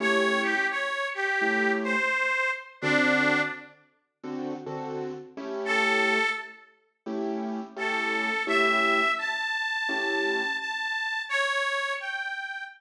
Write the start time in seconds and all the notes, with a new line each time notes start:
0.00 A3 C#4 E4 G4 C#5
0.43 G4
0.70 C#5
1.14 G4
1.41 A3 C#4 E4 G4
1.84 C5
2.81 D3 C4 D4 F#4 A4
4.23 D3 C4 F#4 A4
4.66 D3 C4 F#4 A4
5.37 A3 C#4 E4 G4
5.65 A4
7.06 A3 C#4 E4 G4
7.76 A3 C#4 E4 G4 A4
8.47 A3 C#4 E4 G4 E5
9.18 A5
9.88 A3 C#4 E4 G4
10.59 A5
11.29 C#5
12.00 G5